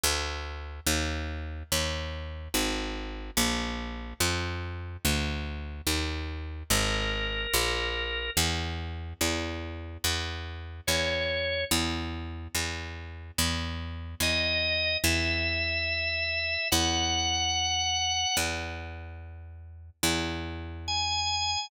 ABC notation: X:1
M:2/2
L:1/8
Q:1/2=72
K:Eb
V:1 name="Drawbar Organ"
z8 | z8 | z8 | z8 |
B8 | [K:E] z8 | z4 c4 | z8 |
z4 d4 | e8 | f8 | z8 |
z4 g4 |]
V:2 name="Electric Bass (finger)" clef=bass
D,,4 E,,4 | E,,4 A,,,4 | B,,,4 F,,4 | D,,4 E,,4 |
A,,,4 B,,,4 | [K:E] E,,4 E,,4 | E,,4 E,,4 | E,,4 E,,4 |
E,,4 E,,4 | E,,8 | E,,8 | E,,8 |
E,,8 |]